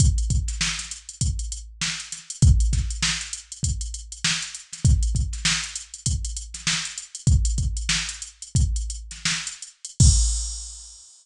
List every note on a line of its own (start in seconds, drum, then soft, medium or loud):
0.00 kick medium
0.00 closed hi-hat loud
0.18 closed hi-hat medium
0.30 kick medium
0.30 closed hi-hat medium
0.48 snare soft
0.48 closed hi-hat medium
0.61 snare medium
0.79 snare soft
0.79 closed hi-hat medium
0.91 closed hi-hat medium
1.09 closed hi-hat medium
1.21 kick medium
1.21 closed hi-hat medium
1.39 closed hi-hat medium
1.52 closed hi-hat medium
1.81 snare medium
2.00 closed hi-hat medium
2.12 snare soft
2.12 closed hi-hat medium
2.30 closed hi-hat medium
2.42 kick loud
2.42 closed hi-hat medium
2.60 closed hi-hat medium
2.73 kick medium
2.73 snare soft
2.73 closed hi-hat medium
2.90 closed hi-hat medium
3.03 snare loud
3.21 closed hi-hat medium
3.33 closed hi-hat medium
3.52 closed hi-hat medium
3.63 kick medium
3.63 closed hi-hat medium
3.81 closed hi-hat medium
3.94 closed hi-hat medium
4.12 closed hi-hat medium
4.24 snare loud
4.42 closed hi-hat medium
4.55 closed hi-hat medium
4.73 snare soft
4.73 closed hi-hat medium
4.85 kick loud
4.85 closed hi-hat medium
5.03 closed hi-hat medium
5.15 kick medium
5.15 closed hi-hat medium
5.33 snare soft
5.33 closed hi-hat medium
5.45 snare loud
5.64 closed hi-hat medium
5.76 closed hi-hat medium
5.94 closed hi-hat medium
6.06 kick medium
6.06 closed hi-hat loud
6.25 closed hi-hat medium
6.36 closed hi-hat medium
6.54 snare soft
6.54 closed hi-hat medium
6.67 snare loud
6.85 closed hi-hat medium
6.98 closed hi-hat medium
7.15 closed hi-hat medium
7.27 kick loud
7.27 closed hi-hat medium
7.45 closed hi-hat medium
7.58 kick medium
7.58 closed hi-hat medium
7.77 closed hi-hat medium
7.89 snare loud
8.09 closed hi-hat medium
8.22 closed hi-hat medium
8.42 closed hi-hat medium
8.55 kick medium
8.55 closed hi-hat medium
8.76 closed hi-hat medium
8.90 closed hi-hat medium
9.11 snare soft
9.11 closed hi-hat medium
9.25 snare medium
9.47 closed hi-hat medium
9.62 closed hi-hat medium
9.85 closed hi-hat medium
10.00 kick loud
10.00 crash loud